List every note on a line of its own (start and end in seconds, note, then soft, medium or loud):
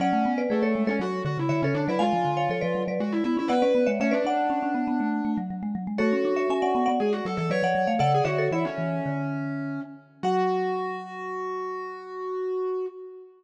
0.00 0.12 F#3 loud
0.00 0.40 C#4 loud
0.00 0.31 D5 loud
0.00 0.31 F#5 loud
0.13 0.25 A3 medium
0.25 0.47 B3 medium
0.38 0.49 B4 medium
0.38 0.50 D5 loud
0.50 0.62 A3 medium
0.50 0.88 A3 medium
0.50 0.62 G#4 medium
0.50 0.62 B4 medium
0.63 0.74 A3 medium
0.63 0.83 A4 medium
0.63 0.83 C#5 loud
0.75 0.87 G#3 medium
0.87 0.99 G#3 medium
0.87 1.01 C#4 medium
0.87 0.99 A4 loud
0.87 0.99 C#5 loud
1.00 1.22 F#3 medium
1.00 1.22 F#4 medium
1.25 1.37 D3 loud
1.25 1.38 F#4 medium
1.38 1.49 C#3 medium
1.38 1.49 E4 medium
1.49 1.61 D3 medium
1.49 1.61 E4 medium
1.49 1.61 C#5 medium
1.49 1.61 E5 loud
1.62 1.74 C#3 medium
1.62 1.75 C#4 medium
1.62 1.85 A4 medium
1.62 1.85 C#5 loud
1.75 1.87 D3 medium
1.75 1.86 D4 medium
1.88 2.00 F#3 medium
1.88 2.01 E4 medium
1.88 2.00 B4 medium
1.88 2.00 D5 medium
1.99 2.12 G#3 loud
1.99 2.82 F4 loud
1.99 2.31 F5 loud
1.99 2.31 G#5 loud
2.13 2.25 F3 medium
2.25 2.47 D3 medium
2.37 2.49 C#5 medium
2.37 2.49 F5 medium
2.50 2.61 F3 medium
2.50 2.62 A4 medium
2.50 2.62 C#5 medium
2.61 2.75 F3 medium
2.61 2.84 B4 medium
2.61 2.84 D5 loud
2.75 2.87 F#3 medium
2.88 2.99 F#3 medium
2.88 3.00 B4 medium
2.88 3.00 D5 medium
3.00 3.22 G#3 loud
3.00 3.12 F#4 medium
3.12 3.24 E4 medium
3.24 3.37 B3 medium
3.24 3.36 E4 medium
3.37 3.49 C#4 medium
3.37 3.51 E4 medium
3.48 3.62 B3 loud
3.48 3.89 B4 medium
3.48 3.61 D5 medium
3.48 3.61 F#5 loud
3.62 3.74 C#4 medium
3.62 3.85 B4 medium
3.62 3.85 D5 medium
3.75 3.87 B3 medium
3.86 3.99 G#3 medium
3.86 3.98 C#5 medium
3.86 3.98 E5 loud
4.00 4.12 A3 medium
4.00 4.13 C#4 loud
4.00 4.13 C#5 loud
4.00 4.13 E5 loud
4.11 4.25 C#4 medium
4.11 5.36 D4 medium
4.11 4.23 B4 loud
4.11 4.23 D5 loud
4.25 4.45 D4 medium
4.25 5.30 D5 loud
4.25 5.30 F#5 loud
4.50 4.62 C#4 medium
4.63 4.74 C#4 medium
4.75 4.86 B3 medium
4.88 4.99 B3 medium
5.00 5.21 A3 medium
5.25 5.37 A3 medium
5.37 5.49 F#3 medium
5.50 5.62 F#3 medium
5.63 5.75 G#3 medium
5.75 5.87 F#3 medium
5.87 5.99 G#3 medium
5.98 6.12 A3 loud
5.98 6.89 F#4 medium
5.98 6.34 A4 loud
5.98 6.34 C#5 loud
6.13 6.24 C#4 medium
6.25 6.46 D4 medium
6.36 6.48 C#5 medium
6.36 6.48 E5 medium
6.50 6.62 C#4 medium
6.50 6.62 E5 medium
6.50 6.62 G#5 loud
6.62 6.74 C#4 medium
6.62 6.85 D5 medium
6.62 6.85 F#5 loud
6.75 6.87 B3 medium
6.86 7.00 B3 medium
6.86 6.98 D5 medium
6.86 6.98 F#5 loud
7.00 7.20 G#3 medium
7.00 7.12 G#4 medium
7.13 7.24 F#4 medium
7.25 7.37 F#3 medium
7.25 7.37 A4 medium
7.37 7.50 E3 loud
7.37 7.49 A4 loud
7.50 7.62 F#3 medium
7.50 7.63 B4 medium
7.50 7.92 C#5 medium
7.50 7.63 D5 loud
7.63 7.75 F3 medium
7.63 7.88 D5 medium
7.63 7.88 F#5 loud
7.75 7.87 F#3 medium
7.87 7.99 A3 medium
7.87 7.99 C#5 medium
7.87 7.99 F5 medium
7.99 8.21 C#3 loud
7.99 8.11 A4 medium
7.99 8.20 D5 loud
7.99 8.20 F#5 loud
8.14 8.27 G#4 medium
8.24 8.49 D3 medium
8.24 8.47 F#4 medium
8.24 8.37 C#5 loud
8.24 8.37 E5 loud
8.38 8.51 A4 loud
8.38 8.51 C#5 loud
8.51 8.64 E3 medium
8.51 8.65 E4 medium
8.51 9.80 C#5 medium
8.51 9.80 E5 loud
8.65 9.81 C#4 medium
8.78 9.00 E3 medium
9.06 9.79 D3 medium
10.23 12.86 F#3 loud
10.23 12.86 F#4 loud
10.23 12.87 F#5 loud